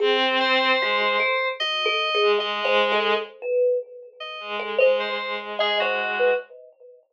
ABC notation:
X:1
M:2/4
L:1/16
Q:1/4=75
K:none
V:1 name="Violin"
C4 ^G,2 z2 | z3 ^G, G, G,3 | z6 ^G,2 | ^G,2 G,6 |]
V:2 name="Kalimba"
^G z3 ^F z A z | (3^F2 A2 ^G2 (3^d2 c2 A2 | z B2 z4 A | c z3 ^d c z B |]
V:3 name="Electric Piano 2"
z2 c6 | ^d4 d2 z d | z5 ^d2 z | ^d c2 z ^G ^F3 |]